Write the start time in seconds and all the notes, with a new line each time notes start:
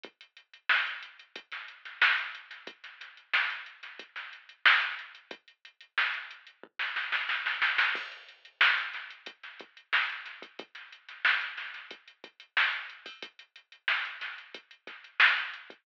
0.03 kick, closed hi-hat
0.21 closed hi-hat
0.37 closed hi-hat
0.53 closed hi-hat
0.69 snare
0.86 closed hi-hat
1.02 closed hi-hat
1.19 closed hi-hat
1.36 kick, closed hi-hat
1.52 snare, closed hi-hat
1.68 closed hi-hat
1.85 snare, closed hi-hat
2.02 snare
2.18 closed hi-hat
2.35 closed hi-hat
2.51 snare, closed hi-hat
2.67 kick, closed hi-hat
2.84 snare, closed hi-hat
3.01 snare, closed hi-hat
3.17 closed hi-hat
3.33 snare
3.50 closed hi-hat
3.66 closed hi-hat
3.83 snare, closed hi-hat
3.99 kick, closed hi-hat
4.16 snare, closed hi-hat
4.33 closed hi-hat
4.49 closed hi-hat
4.65 snare
4.81 closed hi-hat
4.99 closed hi-hat
5.15 closed hi-hat
5.31 kick, closed hi-hat
5.48 closed hi-hat
5.65 closed hi-hat
5.80 closed hi-hat
5.98 snare
6.14 closed hi-hat
6.31 closed hi-hat
6.47 closed hi-hat
6.63 kick
6.79 snare
6.96 snare
7.12 snare
7.29 snare
7.46 snare
7.62 snare
7.78 snare
7.95 kick, crash
8.12 closed hi-hat
8.28 closed hi-hat
8.45 closed hi-hat
8.61 snare
8.77 snare, closed hi-hat
8.93 snare, closed hi-hat
9.10 closed hi-hat
9.26 kick, closed hi-hat
9.43 snare, closed hi-hat
9.59 kick, closed hi-hat
9.77 closed hi-hat
9.93 snare
10.09 closed hi-hat
10.26 snare, closed hi-hat
10.42 kick, closed hi-hat
10.59 kick, closed hi-hat
10.75 snare, closed hi-hat
10.92 closed hi-hat
11.09 snare, closed hi-hat
11.25 snare
11.41 closed hi-hat
11.57 snare, closed hi-hat
11.74 snare, closed hi-hat
11.91 kick, closed hi-hat
12.08 closed hi-hat
12.24 kick, closed hi-hat
12.40 closed hi-hat
12.57 snare
12.73 closed hi-hat
12.90 closed hi-hat
13.06 kick, open hi-hat
13.22 kick, closed hi-hat
13.39 closed hi-hat
13.56 closed hi-hat
13.72 closed hi-hat
13.88 snare
14.05 closed hi-hat
14.21 snare, closed hi-hat
14.38 closed hi-hat
14.54 kick, closed hi-hat
14.71 closed hi-hat
14.87 kick, snare, closed hi-hat
15.04 closed hi-hat
15.20 snare
15.37 closed hi-hat
15.53 closed hi-hat
15.70 kick, closed hi-hat